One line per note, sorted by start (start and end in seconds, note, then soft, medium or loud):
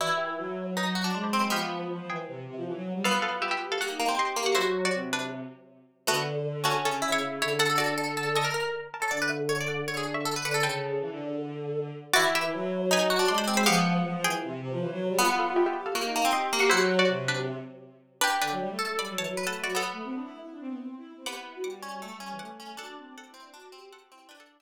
0.00 0.35 E3 medium
0.00 0.64 E4 medium
0.00 0.18 F#4 medium
0.00 0.18 D5 medium
0.18 0.72 G4 medium
0.18 0.72 E5 medium
0.38 1.09 F#3 medium
0.77 0.95 D#4 medium
0.77 1.14 B4 medium
0.77 1.14 G#5 medium
0.95 1.04 F#4 medium
1.04 1.32 D4 medium
1.14 1.52 G#3 medium
1.14 1.23 D5 soft
1.14 1.23 C6 medium
1.24 1.40 C5 medium
1.24 1.40 B5 medium
1.33 1.50 C4 medium
1.41 1.50 C5 medium
1.41 1.50 B5 medium
1.50 1.85 F3 medium
1.50 2.12 B3 medium
1.50 1.98 G4 medium
1.50 1.98 F5 medium
1.90 1.99 F3 medium
1.99 2.08 F3 medium
2.09 2.25 E3 medium
2.09 2.65 G#4 medium
2.09 2.65 G5 medium
2.28 2.44 C3 medium
2.47 2.56 C3 medium
2.56 2.65 F3 medium
2.66 2.75 E3 medium
2.75 2.91 F#3 medium
2.94 3.03 G3 medium
3.04 3.68 B3 medium
3.04 3.52 F4 medium
3.04 3.20 A4 medium
3.04 3.20 F5 medium
3.22 3.31 A4 medium
3.22 3.31 F5 medium
3.42 3.51 G4 medium
3.42 3.51 E5 medium
3.51 3.67 G4 medium
3.51 3.67 E5 medium
3.61 3.77 G4 medium
3.72 3.81 A4 medium
3.72 3.81 F5 medium
3.79 3.98 A#3 medium
3.79 3.88 G4 medium
3.79 4.11 F#5 medium
3.79 4.11 C#6 medium
3.89 4.06 D#4 medium
3.99 4.08 A#3 medium
4.08 4.35 C4 medium
4.17 4.35 G4 medium
4.17 4.47 D#5 medium
4.17 4.47 C6 medium
4.36 4.55 A#3 medium
4.36 4.55 G4 medium
4.46 4.55 F#5 medium
4.46 4.55 C#6 medium
4.55 4.88 F#3 loud
4.55 4.82 E4 medium
4.55 5.26 F#4 medium
4.55 4.82 C5 medium
4.85 5.11 F#4 medium
4.85 5.11 D5 medium
4.94 5.40 C3 medium
5.13 5.68 D4 medium
5.13 5.68 B4 medium
6.07 6.74 D3 medium
6.07 6.23 A3 medium
6.07 6.23 B3 medium
6.07 6.23 F#4 medium
6.64 6.83 A3 medium
6.64 6.99 C#4 medium
6.64 6.83 F#4 medium
6.84 7.38 C#3 medium
6.84 7.10 C#4 medium
6.84 7.10 A4 medium
7.02 7.50 E4 medium
7.12 7.38 E4 medium
7.12 7.38 C#5 medium
7.41 7.59 D3 medium
7.41 7.59 E4 medium
7.41 7.59 C#5 medium
7.59 8.44 D3 medium
7.59 7.68 A4 medium
7.59 7.77 A4 medium
7.59 7.77 F#5 medium
7.70 7.79 A4 medium
7.78 8.25 F#4 medium
7.78 7.96 A4 medium
7.78 8.25 D5 medium
7.98 8.16 A4 medium
8.17 8.34 A4 medium
8.35 8.44 A4 medium
8.35 8.92 D#5 medium
8.35 8.92 C#6 medium
8.44 8.53 A#4 medium
8.54 8.80 A#4 medium
8.94 9.03 A#4 medium
8.94 9.03 A5 medium
9.02 9.11 A4 medium
9.02 9.12 C#5 medium
9.02 9.12 A#5 medium
9.11 9.84 D3 medium
9.11 9.20 D5 medium
9.11 9.29 F#5 medium
9.11 9.29 D6 medium
9.22 9.31 B4 medium
9.29 9.63 E5 medium
9.29 9.63 C#6 medium
9.49 9.58 C#5 medium
9.61 9.86 D5 medium
9.68 10.14 F#5 medium
9.68 10.14 D6 medium
9.87 10.35 D3 medium
9.87 9.97 C#5 medium
9.97 10.06 G#4 medium
10.14 10.40 E5 medium
10.14 10.40 C#6 medium
10.25 10.34 A4 medium
10.36 10.45 B4 medium
10.44 10.61 D3 medium
10.44 10.54 B4 medium
10.44 10.62 F#5 medium
10.44 10.62 D6 medium
10.54 10.63 A4 medium
10.63 10.97 C#3 medium
10.63 11.27 A4 medium
10.63 11.56 B4 medium
10.63 11.56 G5 medium
11.01 11.10 E3 medium
11.11 11.92 D3 medium
12.13 12.50 E3 loud
12.13 12.79 E4 loud
12.13 12.31 F#4 medium
12.13 12.31 D5 loud
12.35 12.89 G4 medium
12.35 12.89 E5 medium
12.53 13.25 F#3 loud
12.91 13.09 D#4 medium
12.91 13.30 B4 medium
12.91 13.30 G#5 medium
13.10 13.19 F#4 medium
13.19 13.46 D4 medium
13.28 13.66 G#3 loud
13.28 13.37 D5 medium
13.28 13.37 C6 medium
13.38 13.56 C5 medium
13.38 13.56 B5 medium
13.47 13.64 C4 medium
13.57 13.66 C5 medium
13.57 13.66 B5 medium
13.66 14.00 F3 loud
13.66 14.28 B3 loud
13.66 14.12 G4 medium
13.66 14.12 F5 loud
14.05 14.14 F3 medium
14.15 14.24 F3 loud
14.24 14.40 E3 medium
14.24 14.80 G#4 medium
14.24 14.80 G5 medium
14.43 14.60 C3 medium
14.61 14.70 C3 loud
14.71 14.80 F3 loud
14.80 14.89 E3 medium
14.91 15.07 F#3 loud
15.09 15.18 G3 loud
15.19 15.81 B3 loud
15.19 15.67 F4 loud
15.19 15.34 A4 medium
15.19 15.34 F5 medium
15.39 15.48 A4 medium
15.39 15.48 F5 medium
15.56 15.65 G4 medium
15.56 15.65 E5 medium
15.66 15.82 G4 medium
15.66 15.82 E5 medium
15.76 15.93 G4 medium
15.86 15.95 A4 medium
15.86 15.95 F5 medium
15.95 16.12 A#3 medium
15.95 16.04 G4 loud
15.95 16.26 F#5 medium
15.95 16.26 C#6 medium
16.04 16.21 D#4 loud
16.16 16.25 A#3 medium
16.25 16.52 C4 medium
16.33 16.50 G4 loud
16.33 16.61 D#5 medium
16.33 16.61 C6 medium
16.52 16.71 A#3 loud
16.52 16.70 G4 loud
16.60 16.69 F#5 medium
16.60 16.69 C#6 medium
16.70 17.02 F#3 loud
16.70 16.96 E4 medium
16.70 17.43 F#4 loud
16.70 16.96 C5 medium
16.99 17.25 F#4 medium
16.99 17.25 D5 medium
17.09 17.55 C3 medium
17.28 17.83 D4 medium
17.28 17.83 B4 medium
18.21 18.37 D4 medium
18.21 18.69 G4 medium
18.21 18.37 B4 medium
18.41 18.50 D3 medium
18.41 18.89 D4 medium
18.41 18.89 B4 medium
18.51 18.60 F#3 medium
18.61 18.70 G3 medium
18.70 18.86 A3 medium
18.79 19.33 A4 medium
18.89 18.98 A3 medium
18.98 19.07 G3 medium
18.98 19.16 D5 medium
18.98 19.16 B5 medium
19.09 19.18 F#3 medium
19.18 19.27 E3 medium
19.18 19.42 C#5 medium
19.18 19.42 A5 medium
19.27 19.45 F#3 medium
19.37 19.71 B4 medium
19.45 19.63 A3 medium
19.45 19.63 A4 medium
19.45 19.63 F#5 medium
19.64 19.75 F#3 medium
19.64 19.73 F#4 medium
19.64 19.73 D5 medium
19.75 20.74 B3 medium
19.75 20.60 A4 medium
19.75 20.60 F#5 medium
19.93 20.02 A3 medium
20.04 20.13 C4 medium
20.14 20.23 D4 medium
20.23 20.40 E4 medium
20.41 20.50 E4 medium
20.51 20.60 D4 medium
20.60 20.69 C4 medium
20.69 20.78 B3 medium
20.80 20.95 C4 medium
20.98 21.15 E4 medium
21.17 21.26 C4 medium
21.26 21.73 B3 medium
21.26 21.36 G4 medium
21.26 21.58 F#5 medium
21.26 21.58 D6 medium
21.36 21.54 E4 medium
21.55 21.64 F#4 medium
21.64 21.88 G3 medium
21.64 22.31 F#5 medium
21.64 22.31 D6 medium
21.83 22.01 C#4 medium
21.93 22.02 G3 medium
22.02 22.18 A3 medium
22.02 22.11 A3 medium
22.13 22.22 G3 medium
22.20 22.31 G3 medium
22.20 22.51 C#4 medium
22.31 22.40 E3 medium
22.39 22.78 A3 medium
22.39 22.74 F#5 medium
22.39 22.74 D6 medium
22.60 22.76 C#4 medium
22.77 23.33 D4 loud
22.77 22.88 F#4 medium
22.77 23.09 A4 medium
22.77 23.09 F#5 medium
22.88 22.97 D4 medium
22.97 23.06 C4 medium
23.07 23.16 C4 medium
23.17 23.29 C4 medium
23.17 23.89 A4 medium
23.17 23.89 F#5 medium
23.29 23.41 E4 medium
23.34 23.52 C4 medium
23.42 23.54 D4 medium
23.54 23.69 D4 medium
23.54 23.72 F#4 medium
23.72 24.09 C4 medium
23.72 24.09 G4 medium
23.92 24.29 A4 medium
23.92 24.29 F#5 medium
24.11 24.27 C4 medium
24.11 24.29 E4 medium
24.29 24.62 D4 loud
24.29 24.62 D4 medium
24.29 24.40 B4 medium
24.29 24.40 G5 medium
24.40 24.58 A4 medium
24.40 24.58 F#5 medium
24.60 24.62 G4 medium
24.60 24.62 E5 medium